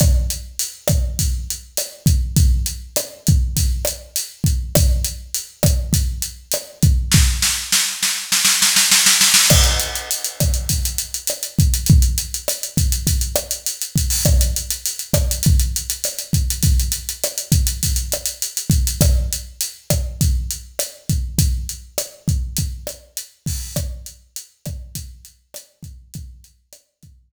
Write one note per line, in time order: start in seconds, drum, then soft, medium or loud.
0.00 kick loud
0.00 cross-stick loud
0.00 closed hi-hat loud
0.30 closed hi-hat medium
0.59 closed hi-hat loud
0.88 kick medium
0.88 cross-stick medium
0.88 closed hi-hat medium
1.19 kick medium
1.19 closed hi-hat loud
1.50 closed hi-hat medium
1.77 cross-stick medium
1.77 closed hi-hat loud
2.06 kick medium
2.06 closed hi-hat medium
2.37 kick loud
2.37 closed hi-hat loud
2.66 closed hi-hat medium
2.96 cross-stick medium
2.96 closed hi-hat medium
3.27 kick medium
3.27 closed hi-hat medium
3.57 kick medium
3.57 closed hi-hat loud
3.85 cross-stick medium
3.85 closed hi-hat medium
4.16 closed hi-hat loud
4.44 kick medium
4.44 closed hi-hat medium
4.75 kick loud
4.75 cross-stick loud
4.75 closed hi-hat loud
5.05 closed hi-hat medium
5.34 closed hi-hat medium
5.63 kick medium
5.63 cross-stick medium
5.63 closed hi-hat medium
5.93 kick medium
5.93 closed hi-hat medium
6.22 closed hi-hat medium
6.52 cross-stick medium
6.52 closed hi-hat loud
6.83 kick medium
6.83 closed hi-hat medium
7.12 kick medium
7.12 snare medium
7.42 snare medium
7.72 snare medium
8.03 snare medium
8.32 snare medium
8.45 snare medium
8.62 snare medium
8.76 snare medium
8.91 snare medium
9.06 snare medium
9.21 snare medium
9.34 snare loud
9.50 kick medium
9.50 cross-stick loud
9.50 crash loud
9.64 closed hi-hat medium
9.80 closed hi-hat medium
9.96 closed hi-hat medium
10.11 closed hi-hat loud
10.25 closed hi-hat medium
10.40 kick medium
10.40 cross-stick medium
10.40 closed hi-hat medium
10.54 closed hi-hat medium
10.69 kick medium
10.69 closed hi-hat loud
10.85 closed hi-hat medium
10.98 closed hi-hat medium
11.14 closed hi-hat medium
11.27 cross-stick medium
11.27 closed hi-hat loud
11.43 closed hi-hat medium
11.59 kick medium
11.59 closed hi-hat medium
11.74 closed hi-hat medium
11.86 kick medium
11.86 closed hi-hat medium
12.02 closed hi-hat medium
12.18 closed hi-hat medium
12.34 closed hi-hat medium
12.48 cross-stick medium
12.48 closed hi-hat loud
12.63 closed hi-hat medium
12.77 kick medium
12.77 closed hi-hat medium
12.92 closed hi-hat medium
13.07 kick medium
13.07 closed hi-hat loud
13.21 closed hi-hat medium
13.36 cross-stick medium
13.36 closed hi-hat medium
13.51 closed hi-hat medium
13.66 closed hi-hat loud
13.82 closed hi-hat medium
13.96 kick medium
13.96 closed hi-hat medium
14.10 open hi-hat medium
14.25 kick loud
14.25 cross-stick loud
14.25 closed hi-hat loud
14.41 closed hi-hat medium
14.56 closed hi-hat medium
14.71 closed hi-hat medium
14.86 closed hi-hat loud
14.99 closed hi-hat medium
15.13 kick medium
15.13 cross-stick loud
15.13 closed hi-hat medium
15.31 closed hi-hat medium
15.43 kick medium
15.43 closed hi-hat loud
15.60 closed hi-hat medium
15.76 closed hi-hat medium
15.90 closed hi-hat medium
16.04 cross-stick medium
16.04 closed hi-hat loud
16.19 closed hi-hat medium
16.33 kick medium
16.33 closed hi-hat medium
16.50 closed hi-hat medium
16.63 kick medium
16.63 closed hi-hat loud
16.80 closed hi-hat medium
16.92 closed hi-hat medium
17.09 closed hi-hat medium
17.24 cross-stick medium
17.24 closed hi-hat medium
17.38 closed hi-hat medium
17.52 kick medium
17.52 closed hi-hat medium
17.67 closed hi-hat medium
17.83 kick medium
17.83 closed hi-hat loud
17.96 closed hi-hat medium
18.12 cross-stick medium
18.12 closed hi-hat medium
18.26 closed hi-hat medium
18.42 closed hi-hat medium
18.57 closed hi-hat medium
18.70 kick medium
18.70 closed hi-hat medium
18.87 closed hi-hat medium
19.01 kick loud
19.01 cross-stick loud
19.01 closed hi-hat loud
19.33 closed hi-hat medium
19.61 closed hi-hat loud
19.90 kick medium
19.90 cross-stick medium
19.90 closed hi-hat medium
20.21 kick medium
20.21 closed hi-hat medium
20.51 closed hi-hat medium
20.79 cross-stick medium
20.79 closed hi-hat loud
21.09 kick medium
21.09 closed hi-hat medium
21.38 kick loud
21.38 closed hi-hat loud
21.69 closed hi-hat medium
21.98 cross-stick loud
21.98 closed hi-hat loud
22.28 kick medium
22.28 closed hi-hat medium
22.57 kick medium
22.57 closed hi-hat loud
22.87 cross-stick medium
22.87 closed hi-hat medium
23.17 closed hi-hat medium
23.46 kick medium
23.46 open hi-hat medium
23.76 kick medium
23.76 cross-stick loud
23.76 closed hi-hat medium
24.06 closed hi-hat medium
24.36 closed hi-hat loud
24.66 kick medium
24.66 cross-stick medium
24.66 closed hi-hat medium
24.95 kick medium
24.95 closed hi-hat loud
25.25 closed hi-hat medium
25.54 cross-stick medium
25.54 closed hi-hat loud
25.83 kick medium
25.83 closed hi-hat medium
26.14 kick loud
26.14 closed hi-hat loud
26.44 closed hi-hat medium
26.73 cross-stick medium
26.73 closed hi-hat loud
27.03 kick medium
27.03 closed hi-hat medium